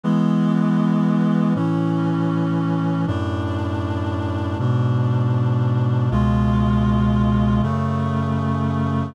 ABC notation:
X:1
M:4/4
L:1/8
Q:1/4=79
K:A
V:1 name="Clarinet"
[E,G,B,]4 [A,,E,C]4 | [F,,A,,D]4 [G,,B,,D]4 | [C,,B,,G,^E]4 [F,,C,A,]4 |]